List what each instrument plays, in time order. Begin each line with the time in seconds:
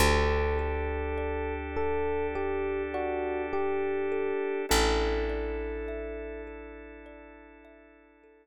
0.00 electric bass (finger) D2, drawbar organ D4 G4 A4, kalimba G4, electric piano 1 A4
0.59 kalimba A4
1.18 kalimba D5
1.76 kalimba G4, electric piano 1 A4
2.35 electric piano 1 G4, kalimba A4
2.94 electric piano 1 F#4, kalimba D5
3.53 kalimba G4, electric piano 1 G4
4.12 kalimba A4
4.69 electric bass (finger) A1, drawbar organ D4 E4 A4, kalimba A4, electric piano 1 A4
5.29 kalimba D5
5.88 kalimba E5
6.47 kalimba A4
7.06 kalimba D5
7.65 kalimba E5
8.24 kalimba A4